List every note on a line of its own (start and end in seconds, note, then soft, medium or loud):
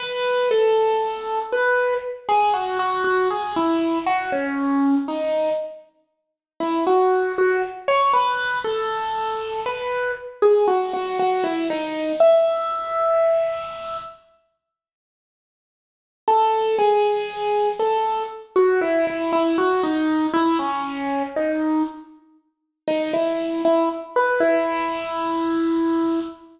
0.00 0.49 B4 loud
0.51 1.39 A4 loud
1.53 1.94 B4 loud
2.29 2.53 G#4 loud
2.54 2.78 F#4 medium
2.79 3.03 F#4 loud
3.04 3.28 F#4 medium
3.31 3.55 G#4 medium
3.56 3.99 E4 medium
4.06 4.31 F#4 loud
4.32 4.95 C#4 medium
5.08 5.50 D#4 medium
6.60 6.84 E4 medium
6.87 7.32 F#4 medium
7.38 7.62 F#4 loud
7.88 8.12 C#5 loud
8.13 8.59 B4 loud
8.64 9.60 A4 medium
9.66 10.12 B4 medium
10.42 10.66 G#4 medium
10.68 10.92 F#4 medium
10.93 11.18 F#4 medium
11.19 11.44 F#4 medium
11.44 11.68 E4 medium
11.70 12.12 D#4 medium
12.20 13.97 E5 loud
16.28 16.76 A4 loud
16.79 17.69 G#4 loud
17.79 18.23 A4 medium
18.56 18.80 F#4 loud
18.81 19.06 E4 loud
19.07 19.31 E4 medium
19.33 19.57 E4 loud
19.58 19.82 F#4 medium
19.83 20.26 D#4 loud
20.33 20.58 E4 loud
20.59 21.23 C#4 medium
21.36 21.83 D#4 medium
22.88 23.12 D#4 medium
23.13 23.61 E4 medium
23.65 23.89 E4 loud
24.16 24.40 B4 medium
24.40 26.20 E4 loud